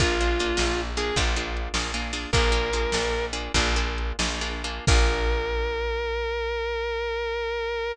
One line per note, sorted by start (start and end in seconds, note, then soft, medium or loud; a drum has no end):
0.00 0.52 A#1 medium
0.00 0.18 A#3 loud
0.00 0.18 D4 medium
0.00 0.18 F4 medium
0.00 0.81 F4 loud
0.00 0.18 G#4 loud
0.00 kick medium
0.00 closed hi-hat medium
0.20 0.38 A#3 medium
0.20 0.38 D4 medium
0.20 0.38 F4 medium
0.20 0.38 G#4 medium
0.39 0.56 A#3 medium
0.39 0.56 D4 medium
0.39 0.56 F4 medium
0.39 0.56 G#4 medium
0.39 closed hi-hat medium
0.57 1.11 A#1 medium
0.57 0.93 A#3 medium
0.57 0.93 D4 medium
0.57 0.93 F4 medium
0.57 0.93 G#4 medium
0.57 snare medium
0.97 1.15 A#3 medium
0.97 1.15 D4 medium
0.97 1.15 F4 medium
0.97 1.15 G#4 medium
0.97 1.16 G#4 medium
0.97 closed hi-hat medium
1.16 1.69 A#1 loud
1.16 1.35 A#3 loud
1.16 1.35 D4 loud
1.16 1.35 F4 loud
1.16 1.35 G#4 medium
1.16 kick medium
1.16 closed hi-hat loud
1.36 1.72 A#3 medium
1.36 1.72 D4 medium
1.36 1.72 F4 medium
1.36 1.72 G#4 medium
1.57 closed hi-hat medium
1.74 2.26 A#1 medium
1.74 1.92 A#3 medium
1.74 1.92 D4 medium
1.74 1.92 F4 medium
1.74 1.92 G#4 medium
1.74 snare medium
1.94 2.12 A#3 medium
1.94 2.12 D4 medium
1.94 2.12 F4 medium
1.94 2.12 G#4 medium
2.13 2.31 A#3 medium
2.13 2.31 D4 medium
2.13 2.31 F4 medium
2.13 2.31 G#4 medium
2.13 open hi-hat medium
2.33 2.86 A#1 loud
2.33 2.51 A#3 loud
2.33 2.51 D4 loud
2.33 2.51 F4 medium
2.33 2.51 G#4 medium
2.33 3.25 A#4 medium
2.33 kick medium
2.33 closed hi-hat medium
2.52 2.70 A#3 medium
2.52 2.70 D4 medium
2.52 2.70 F4 loud
2.52 2.70 G#4 medium
2.73 2.92 A#3 medium
2.73 2.92 D4 medium
2.73 2.92 F4 medium
2.73 2.92 G#4 medium
2.73 closed hi-hat medium
2.92 3.49 A#1 medium
2.92 3.31 A#3 medium
2.92 3.31 D4 medium
2.92 3.31 F4 medium
2.92 3.31 G#4 medium
2.92 snare medium
3.33 3.52 A#3 medium
3.33 3.52 D4 medium
3.33 3.52 F4 medium
3.33 3.52 G#4 medium
3.33 closed hi-hat medium
3.54 4.13 A#1 loud
3.54 3.75 A#3 loud
3.54 3.75 D4 loud
3.54 3.75 F4 medium
3.54 3.75 G#4 medium
3.54 kick medium
3.54 closed hi-hat medium
3.76 4.16 A#3 medium
3.76 4.16 D4 medium
3.76 4.16 F4 medium
3.76 4.16 G#4 medium
3.98 closed hi-hat medium
4.19 4.80 A#1 medium
4.19 4.39 A#3 medium
4.19 4.39 D4 medium
4.19 4.39 F4 medium
4.19 4.39 G#4 medium
4.19 snare loud
4.41 4.62 A#3 medium
4.41 4.62 D4 medium
4.41 4.62 F4 medium
4.41 4.62 G#4 medium
4.64 4.85 A#3 medium
4.64 4.85 D4 medium
4.64 4.85 F4 medium
4.64 4.85 G#4 medium
4.64 closed hi-hat medium
4.87 7.92 A#1 loud
4.87 7.92 A#3 medium
4.87 7.92 D4 loud
4.87 7.92 F4 loud
4.87 7.92 G#4 loud
4.87 7.92 A#4 loud
4.87 kick loud
4.87 crash loud